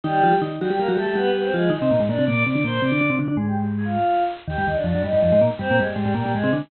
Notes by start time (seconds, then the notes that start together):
0.03 D#3 G3 D#4 G4
0.24 F3 F4
0.33 G3 G4
0.42 D#3 D#4
0.61 F#3 G3 F#4 G4
0.70 G3 G4
0.79 G3 A#3 G4 A#4
0.88 F#3 G3 F#4 G4
0.97 G3 A3 G4 A4
1.06 G3 A3 G4 A4
1.15 G3 B3 G4 B4
1.34 B3 B4
1.43 C4 C5
1.53 F3 G#3 F4 G#4
1.70 D#3 D#4 D#5
1.82 C3 C4
1.91 A#2 A#3
2.00 G#2 G#3
2.08 A#2 A#3 D4 D5
2.19 C3 C4
2.26 A#2 A#3 D5 D6
2.45 C3 C4 D5 D6
2.54 D3 D4 D5 D6
2.64 A#2 A#3 C5 C6
2.82 C3 C4 D5 D6
2.92 D3 D4
3.01 D3 D4
3.10 C3 C4
3.19 D3 D4 D5 D6
3.28 D3 D4
3.36 G#2 G#3 G#4 G#5
3.47 G4 G5
3.56 G4 G5
3.76 G#4 G#5
3.85 F4 F5
4.48 D#2 D#3 G4 G5
4.58 G2 G3
4.67 D#2 D#3 D#4 D#5
4.76 D4 D5
4.84 F2 F3 D4 D5
4.95 F#2 F#3
5.04 G2 G3 D#4 D#5
5.13 G2 G3
5.22 F2 F3 D#4 D#5
5.32 G#2 G#3
5.41 A#2 A#3
5.59 G2 G3 C4 C5
5.71 A#2 A#3
5.79 G2 G3 G#3 G#4
5.88 G3 G4
5.96 G#2 G3 G#3 G4
6.05 G#2 G#3
6.14 A#2 G3 A#3 G4
6.26 A#2 A#3
6.34 G#2 G#3 G#4
6.44 C3 C4
6.53 D3 D4